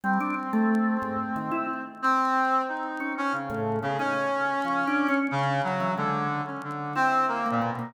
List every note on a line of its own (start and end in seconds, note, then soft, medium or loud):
0.04 0.19 G3 loud
0.04 1.82 C4 medium
0.20 0.35 D4 medium
0.53 0.97 A3 loud
1.02 1.17 G#2 medium
1.36 1.51 D#3 medium
1.51 1.66 E4 medium
2.02 2.62 C4 loud
2.68 3.13 D#4 medium
3.00 3.15 C#4 medium
3.18 3.32 C#4 loud
3.32 3.77 C#3 medium
3.50 3.79 A2 loud
3.82 3.97 C#3 medium
3.82 3.97 B3 medium
3.99 5.17 C#4 loud
3.99 4.14 D#4 medium
4.65 4.84 F3 medium
4.87 5.07 D4 medium
5.08 5.28 C#4 loud
5.31 5.61 C#3 loud
5.64 5.93 F#3 medium
5.80 5.95 E3 medium
5.97 6.41 D3 medium
5.97 6.27 G#3 medium
6.47 6.61 C#4 medium
6.64 6.93 D3 medium
6.95 7.25 C4 loud
6.95 7.40 E4 medium
7.28 7.48 A#3 medium
7.46 7.61 A#3 medium
7.51 7.70 A#2 medium
7.61 7.76 B2 medium
7.72 7.92 B2 medium
7.79 7.93 A#3 medium